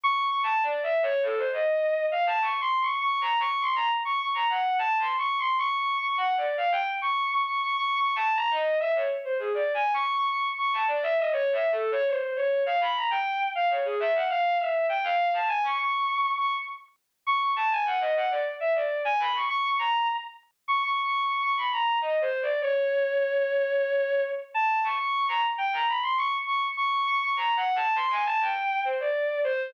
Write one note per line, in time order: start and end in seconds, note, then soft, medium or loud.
0.04 0.21 C#6 loud
0.24 0.41 C#6 medium
0.43 0.61 A5 medium
0.63 0.81 D5 medium
0.83 1.01 E5 medium
1.03 1.21 C#5 loud
1.23 1.36 A4 medium
1.37 1.50 C5 medium
1.52 2.06 D#5 medium
2.12 2.25 F5 medium
2.27 2.40 A5 medium
2.41 2.59 C#6 medium
2.61 2.79 C6 medium
2.81 2.99 C#6 medium
3.01 3.19 C#6 medium
3.21 3.39 A#5 medium
3.40 3.58 C#6 loud
3.61 3.74 C6 medium
3.75 3.89 A#5 medium
4.05 4.18 C#6 medium
4.20 4.33 C#6 medium
4.34 4.48 A#5 medium
4.50 4.76 F#5 medium
4.79 4.97 A5 loud
4.99 5.16 C6 medium
5.18 5.36 C#6 medium
5.38 5.56 C6 medium
5.59 5.76 C#6 loud
5.78 5.96 C#6 medium
5.98 6.15 C#6 medium
6.17 6.35 F#5 medium
6.37 6.55 D5 medium
6.57 6.71 F5 medium
6.72 6.85 G5 loud
7.02 7.28 C#6 medium
7.31 7.45 C#6 medium
7.46 7.60 C#6 medium
7.61 7.75 C#6 medium
7.76 7.94 C#6 medium
7.96 8.14 C#6 medium
8.16 8.34 A5 loud
8.36 8.49 A#5 loud
8.50 8.77 D#5 medium
8.80 8.93 E5 medium
8.95 9.08 C#5 medium
9.24 9.38 C5 medium
9.39 9.52 G#4 medium
9.54 9.72 D5 medium
9.74 9.92 G#5 medium
9.94 10.12 C#6 loud
10.14 10.27 C#6 loud
10.29 10.42 C#6 medium
10.58 10.72 C#6 medium
10.73 10.87 A5 medium
10.88 11.01 D5 medium
11.03 11.16 E5 loud
11.18 11.31 D#5 medium
11.32 11.50 C#5 loud
11.53 11.70 E5 medium
11.72 11.90 A4 medium
11.92 12.05 C#5 loud
12.07 12.33 C5 medium
12.36 12.63 C#5 medium
12.66 12.79 F5 medium
12.81 12.94 B5 medium
12.96 13.09 A#5 medium
13.11 13.37 G5 medium
13.55 13.69 F5 medium
13.70 13.84 C#5 medium
13.85 13.98 G#4 medium
14.00 14.13 E5 loud
14.14 14.28 F#5 medium
14.30 14.56 F5 loud
14.60 14.86 E5 medium
14.89 15.02 G5 medium
15.04 15.31 F5 loud
15.33 15.47 A5 medium
15.48 15.62 G#5 loud
15.63 15.77 C#6 medium
15.78 16.31 C#6 medium
16.37 16.51 C#6 medium
17.27 17.40 C#6 medium
17.41 17.54 C#6 medium
17.56 17.70 A5 medium
17.71 17.85 G#5 medium
17.86 17.99 F#5 medium
18.01 18.14 D#5 medium
18.16 18.29 F#5 medium
18.31 18.44 D5 medium
18.60 18.74 E5 medium
18.75 19.02 D5 medium
19.05 19.18 G#5 loud
19.19 19.33 B5 medium
19.35 19.48 C#6 medium
19.49 19.62 C#6 loud
19.64 19.78 C#6 medium
19.79 20.06 A#5 medium
20.68 20.81 C#6 medium
20.83 21.01 C#6 medium
21.03 21.21 C#6 medium
21.22 21.40 C#6 medium
21.42 21.55 C#6 medium
21.57 21.70 B5 medium
21.72 21.99 A#5 medium
22.02 22.19 D#5 medium
22.21 22.39 C5 medium
22.42 22.60 D5 medium
22.61 24.22 C#5 medium
24.54 24.81 A5 medium
24.84 24.97 C#6 medium
24.99 25.26 C#6 medium
25.28 25.42 A#5 medium
25.58 25.71 G5 medium
25.73 25.86 A#5 medium
25.88 26.01 B5 medium
26.03 26.16 C6 medium
26.18 26.31 C#6 loud
26.47 26.60 C#6 medium
26.77 26.90 C#6 loud
26.92 27.05 C#6 medium
27.07 27.20 C#6 loud
27.21 27.35 C#6 medium
27.36 27.54 A#5 medium
27.56 27.74 F#5 medium
27.76 27.94 A5 loud
27.96 28.09 C6 loud
28.11 28.24 G#5 medium
28.26 28.39 A5 loud
28.40 28.80 G5 medium
28.85 28.98 C5 medium
29.00 29.40 D5 medium
29.44 29.71 C5 loud